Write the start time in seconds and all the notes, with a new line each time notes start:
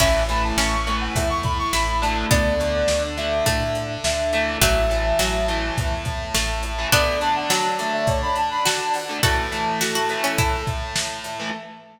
0.00 A1 E3 A3 C#4 E4 A4 E5, kick, crash
0.29 E3 A3 B5, closed hi-hat
0.44 A5
0.57 A1 C#4 C#6, snare
0.87 E3 A3, closed hi-hat
1.01 F#5
1.15 E2 E5, kick, closed hi-hat
1.30 C#6
1.43 B5, kick, closed hi-hat
1.59 C#6
1.73 A1 E4 B5, snare
2.02 D3 A3 A5, closed hi-hat
2.31 D2 B3 D4 A4 D5, kick, closed hi-hat
2.60 D3 A3, closed hi-hat
2.88 D2, snare
3.17 D3 A3 E5, closed hi-hat
3.46 A2 A3, kick, closed hi-hat
3.75 closed hi-hat
4.04 D2 E5, snare
4.33 E3 A3, closed hi-hat
4.61 A1 F#3 A3 E4 A4 E5 A5, kick, closed hi-hat
4.90 E3 A3, closed hi-hat
5.19 A1 F#3, snare
5.48 E3 A3, closed hi-hat
5.77 E2, kick, closed hi-hat
6.05 kick, closed hi-hat
6.34 A1 A3, snare
6.63 closed hi-hat
6.78 E3 A3
6.92 D3 A3 B3 D4 A4 D5 A5, kick, closed hi-hat
7.21 D3 A3 A5, closed hi-hat
7.36 F#5
7.50 F#3 A5, snare
7.79 D3 A3, closed hi-hat
7.93 E5
8.07 C#5, kick, closed hi-hat
8.22 B5
8.36 A5, closed hi-hat
8.51 B5
8.65 F#4 A5, snare
8.94 F#5, open hi-hat
9.09 D3 A3
9.23 E3 A3 E4 F#4 A4 E5 A5, kick, closed hi-hat
9.52 E3 A3, closed hi-hat
9.81 F#4, snare
9.95 F#4
10.09 E3 A3, closed hi-hat
10.24 C#4
10.38 E4, kick, closed hi-hat
10.67 kick, closed hi-hat
10.96 snare
11.24 closed hi-hat
11.40 E3 A3